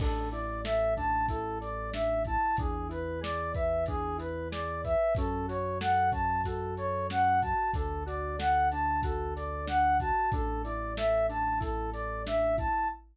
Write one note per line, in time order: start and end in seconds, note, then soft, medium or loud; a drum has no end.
0.00 2.37 A1 medium
0.00 0.30 D4 loud
0.00 0.29 A4 medium
0.00 kick loud
0.00 crash loud
0.31 0.61 E4 medium
0.31 0.61 D5 medium
0.31 closed hi-hat medium
0.64 0.93 A4 medium
0.64 0.94 E5 medium
0.64 snare loud
0.97 1.26 D4 medium
0.97 1.26 A5 medium
0.97 kick medium
0.97 closed hi-hat medium
1.28 1.58 E4 medium
1.28 1.58 A4 medium
1.28 kick loud
1.28 closed hi-hat loud
1.60 1.89 A4 medium
1.60 1.90 D5 medium
1.60 closed hi-hat medium
1.93 2.22 D4 medium
1.93 2.23 E5 medium
1.93 snare loud
2.25 2.56 E4 medium
2.25 2.56 A5 medium
2.25 kick medium
2.25 closed hi-hat medium
2.57 4.96 E2 medium
2.57 2.88 D4 medium
2.57 2.88 G#4 medium
2.57 kick loud
2.57 closed hi-hat loud
2.89 3.18 E4 medium
2.89 3.20 B4 medium
2.89 closed hi-hat medium
3.21 3.50 G#4 medium
3.21 3.52 D5 medium
3.21 snare loud
3.54 3.84 B4 medium
3.54 3.85 E5 medium
3.54 kick loud
3.54 closed hi-hat medium
3.86 4.16 D4 medium
3.86 4.17 G#4 medium
3.86 kick loud
3.86 closed hi-hat loud
4.18 4.47 E4 medium
4.18 4.48 B4 medium
4.18 closed hi-hat medium
4.51 4.80 G#4 medium
4.51 4.81 D5 medium
4.51 snare loud
4.84 5.13 B4 medium
4.84 5.14 E5 medium
4.84 kick medium
4.84 closed hi-hat medium
5.15 7.54 F#2 medium
5.15 5.47 C#4 loud
5.15 5.46 A4 medium
5.15 kick loud
5.15 closed hi-hat loud
5.48 5.77 F#4 medium
5.48 5.78 C#5 medium
5.48 closed hi-hat medium
5.80 6.10 A4 medium
5.80 6.10 F#5 medium
5.80 snare loud
6.12 6.41 C#4 medium
6.12 6.42 A5 medium
6.12 kick loud
6.12 closed hi-hat medium
6.44 6.74 F#4 medium
6.44 6.75 A4 medium
6.44 kick medium
6.44 closed hi-hat loud
6.77 7.07 A4 medium
6.77 7.07 C#5 medium
6.77 closed hi-hat medium
7.10 7.39 C#4 medium
7.10 7.40 F#5 medium
7.10 snare loud
7.42 7.72 F#4 medium
7.42 7.71 A5 medium
7.42 kick medium
7.42 closed hi-hat medium
7.74 10.12 D2 medium
7.74 8.04 D4 medium
7.74 8.03 A4 medium
7.74 kick loud
7.74 closed hi-hat loud
8.06 8.35 F#4 medium
8.06 8.36 D5 medium
8.06 closed hi-hat medium
8.38 8.67 A4 medium
8.38 8.69 F#5 medium
8.38 snare loud
8.71 9.01 D4 medium
8.71 9.01 A5 medium
8.71 closed hi-hat medium
9.03 9.33 F#4 medium
9.03 9.34 A4 medium
9.03 kick loud
9.03 closed hi-hat loud
9.36 9.66 A4 medium
9.36 9.65 D5 medium
9.36 closed hi-hat medium
9.67 9.96 D4 medium
9.67 9.98 F#5 medium
9.67 snare loud
10.00 10.30 F#4 medium
10.00 10.30 A5 medium
10.00 kick medium
10.00 closed hi-hat medium
10.32 12.69 A1 medium
10.32 10.62 D4 loud
10.32 10.62 A4 medium
10.32 kick loud
10.32 closed hi-hat loud
10.64 10.94 E4 medium
10.64 10.94 D5 medium
10.64 closed hi-hat medium
10.97 11.26 A4 medium
10.97 11.26 E5 medium
10.97 snare loud
11.29 11.58 D4 medium
11.29 11.59 A5 medium
11.29 closed hi-hat medium
11.60 11.89 E4 medium
11.60 11.90 A4 medium
11.60 kick loud
11.60 closed hi-hat loud
11.93 12.23 A4 medium
11.93 12.23 D5 medium
11.93 closed hi-hat medium
12.26 12.55 D4 medium
12.26 12.56 E5 medium
12.26 snare loud
12.57 12.86 E4 medium
12.57 12.88 A5 medium
12.57 kick loud
12.57 closed hi-hat medium